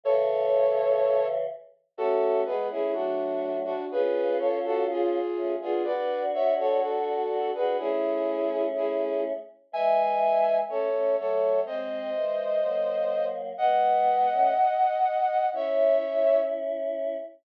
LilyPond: <<
  \new Staff \with { instrumentName = "Flute" } { \time 2/2 \key cis \minor \tempo 2 = 62 <a' cis''>2. r4 | \key fis \minor <fis' a'>4 <gis' b'>8 <e' gis'>8 <d' fis'>4. <d' fis'>8 | <gis' b'>4 <a' cis''>8 <fis' a'>8 <eis' gis'>4. <eis' gis'>8 | <b' d''>4 <cis'' e''>8 <a' cis''>8 <fis' a'>4. <gis' b'>8 |
<e' gis'>2 <e' gis'>4 r4 | \key cis \minor <e'' gis''>2 <a' cis''>4 <a' cis''>4 | <bis' dis''>1 | <dis'' fis''>1 |
<cis'' e''>2 r2 | }
  \new Staff \with { instrumentName = "Choir Aahs" } { \time 2/2 \key cis \minor <cis e>2.~ <cis e>8 r8 | \key fis \minor <a cis'>4 <gis b>8 <a cis'>8 <fis a>2 | <cis' eis'>2. <a cis'>8 <b d'>8 | <d' fis'>2. <d' fis'>8 <d' fis'>8 |
<a cis'>2.~ <a cis'>8 r8 | \key cis \minor <e gis>2 <a cis'>8 <a cis'>8 <fis a>4 | <gis bis>4 <e gis>4 <fis ais>2 | <gis b>4. <a cis'>8 r2 |
<cis' e'>2.~ <cis' e'>8 r8 | }
>>